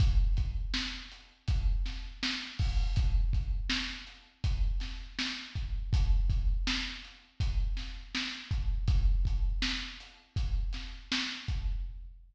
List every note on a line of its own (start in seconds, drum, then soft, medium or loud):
0.00 kick loud
0.00 closed hi-hat loud
0.37 kick medium
0.37 closed hi-hat medium
0.74 snare medium
1.12 closed hi-hat medium
1.48 kick medium
1.48 closed hi-hat loud
1.86 snare medium
1.86 closed hi-hat medium
2.23 snare loud
2.59 kick medium
2.59 open hi-hat medium
2.96 kick medium
2.96 closed hi-hat loud
3.33 kick medium
3.33 closed hi-hat medium
3.70 snare loud
4.07 closed hi-hat medium
4.44 kick medium
4.44 closed hi-hat loud
4.80 snare medium
4.80 closed hi-hat medium
5.19 snare loud
5.55 kick medium
5.55 closed hi-hat medium
5.93 kick loud
5.93 closed hi-hat loud
6.30 kick medium
6.30 closed hi-hat medium
6.67 snare loud
7.04 closed hi-hat medium
7.40 kick medium
7.40 closed hi-hat loud
7.77 snare medium
7.77 closed hi-hat medium
8.15 snare medium
8.51 kick medium
8.51 closed hi-hat medium
8.88 kick loud
8.88 closed hi-hat medium
9.25 kick medium
9.25 closed hi-hat medium
9.62 snare loud
10.00 closed hi-hat medium
10.36 kick medium
10.36 closed hi-hat medium
10.73 snare medium
10.73 closed hi-hat medium
11.12 snare loud
11.48 kick medium
11.48 closed hi-hat medium